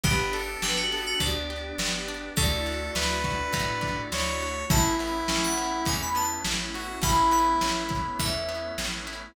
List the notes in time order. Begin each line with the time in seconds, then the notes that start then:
0.04 G1 B3 D4 G4 B4, kick, ride
0.33 D4 A4, ride
0.62 G1 G4 B4, snare
0.76 F#4
0.92 B3 A4, ride
1.06 F#4
1.20 D2 D4 D5, kick, ride
1.50 G4, ride
1.78 G1 B3, snare
2.08 D4, ride
2.36 D2 A3 D4 E4 F#4 A4 D5, kick, ride
2.66 D4, ride
2.95 D2 E4 B4, snare
3.24 F#4, kick, ride
3.53 A2 A3, kick, ride
3.81 D4, kick, ride
4.12 D2 E4 C#5, snare
4.41 F#4, ride
4.70 A1 A3 B3 C#4 E4 A5, kick, ride
4.99 B3 E4, ride
5.28 A1 C#4, snare
5.43 F#5
5.58 E4, ride
5.85 E2 A3 G#5, kick, ride
6.02 B5
6.15 B3 A5, ride
6.45 A1 C#4, snare
6.74 E4 F#4, ride
7.01 A1 A3 B3 C#4 E4 B5, kick, ride
7.31 B3 B5, ride
7.61 A1 C#4, snare
7.89 E4, kick, ride
8.19 E2 A3 E5, kick, ride
8.49 B3, ride
8.78 A1 C#4, snare
9.07 E4, ride